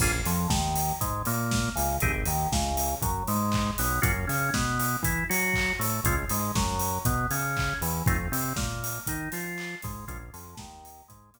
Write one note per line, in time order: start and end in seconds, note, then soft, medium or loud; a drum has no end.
0.00 0.22 A#1 loud
0.00 0.12 A#3 medium
0.00 0.12 C#4 medium
0.00 0.12 F4 medium
0.00 0.12 G#4 medium
0.00 kick loud
0.00 crash loud
0.26 0.47 F2 loud
0.26 0.48 F3 loud
0.26 open hi-hat medium
0.49 0.93 D#2 medium
0.49 0.92 D#3 medium
0.49 kick medium
0.49 snare loud
0.76 open hi-hat medium
1.01 1.23 G#2 medium
1.01 1.22 G#3 medium
1.01 kick medium
1.01 closed hi-hat loud
1.25 1.69 A#2 loud
1.25 1.69 A#3 medium
1.25 open hi-hat medium
1.51 kick medium
1.51 snare loud
1.76 1.99 C#2 loud
1.76 1.97 C#3 medium
1.76 open hi-hat medium
2.00 2.24 G#1 loud
2.00 2.12 C4 medium
2.00 2.12 D#4 medium
2.00 2.12 G4 medium
2.00 2.12 G#4 medium
2.00 kick loud
2.00 closed hi-hat loud
2.25 2.47 D#2 medium
2.25 2.49 D#3 medium
2.25 open hi-hat medium
2.52 2.95 C#2 loud
2.52 2.95 C#3 medium
2.52 kick medium
2.52 snare loud
2.77 open hi-hat medium
3.02 3.23 F#2 medium
3.02 3.24 F#3 medium
3.02 kick medium
3.02 closed hi-hat loud
3.28 3.71 G#2 loud
3.28 3.71 G#3 medium
3.28 open hi-hat medium
3.52 kick medium
3.52 clap loud
3.78 4.00 B1 loud
3.78 4.00 B3 medium
3.78 open hi-hat medium
4.02 4.25 F#2 loud
4.02 4.12 A#3 medium
4.02 4.12 C#4 medium
4.02 4.12 F4 medium
4.02 4.12 F#4 loud
4.02 kick loud
4.02 closed hi-hat loud
4.27 4.50 C#3 loud
4.27 4.49 C#4 loud
4.27 open hi-hat medium
4.54 4.97 B2 medium
4.54 4.97 B3 medium
4.54 kick medium
4.54 snare loud
4.80 open hi-hat medium
5.03 5.24 E3 medium
5.03 5.26 E4 medium
5.03 kick medium
5.03 closed hi-hat loud
5.29 5.73 F#3 loud
5.29 5.72 F#4 medium
5.29 open hi-hat medium
5.54 kick medium
5.54 clap loud
5.79 6.01 A2 medium
5.79 6.01 A3 medium
5.79 open hi-hat medium
6.04 6.26 C#2 loud
6.04 6.16 G#3 medium
6.04 6.16 C4 medium
6.04 6.16 C#4 medium
6.04 6.16 F4 medium
6.04 kick loud
6.04 closed hi-hat loud
6.29 6.52 G#2 medium
6.29 6.52 G#3 medium
6.29 open hi-hat medium
6.55 6.99 F#2 loud
6.55 6.98 F#3 medium
6.55 kick loud
6.55 snare loud
6.80 open hi-hat medium
7.05 7.27 B2 loud
7.05 7.27 B3 medium
7.05 kick loud
7.05 closed hi-hat loud
7.31 7.74 C#3 loud
7.31 7.74 C#4 medium
7.31 open hi-hat medium
7.57 kick medium
7.57 clap loud
7.81 8.03 E2 medium
7.81 8.04 E3 medium
7.81 open hi-hat medium
8.06 8.28 F2 loud
8.06 8.17 A3 medium
8.06 8.17 C4 medium
8.06 8.17 D#4 medium
8.06 8.17 F4 medium
8.06 kick loud
8.06 closed hi-hat loud
8.32 8.53 C3 loud
8.32 8.53 C4 medium
8.32 open hi-hat medium
8.56 8.99 A#2 medium
8.56 9.00 A#3 medium
8.56 kick loud
8.56 snare loud
8.84 open hi-hat medium
9.07 9.29 D#3 medium
9.07 9.30 D#4 medium
9.07 kick medium
9.07 closed hi-hat loud
9.32 9.75 F3 medium
9.32 9.76 F4 medium
9.32 open hi-hat medium
9.58 clap loud
9.82 10.05 G#2 loud
9.82 10.05 G#3 medium
9.82 kick loud
9.82 open hi-hat medium
10.08 10.30 A#1 loud
10.08 10.18 G#3 medium
10.08 10.18 A#3 medium
10.08 10.18 C#4 medium
10.08 10.18 F4 medium
10.08 kick loud
10.08 closed hi-hat loud
10.33 10.55 F2 loud
10.33 10.55 F3 loud
10.33 open hi-hat medium
10.57 11.03 D#2 loud
10.57 11.01 D#3 medium
10.57 kick medium
10.57 snare loud
10.85 open hi-hat medium
11.08 11.31 G#2 loud
11.08 11.30 G#3 medium
11.08 kick medium
11.08 closed hi-hat loud
11.34 11.39 A#2 medium
11.34 11.39 A#3 medium
11.34 open hi-hat medium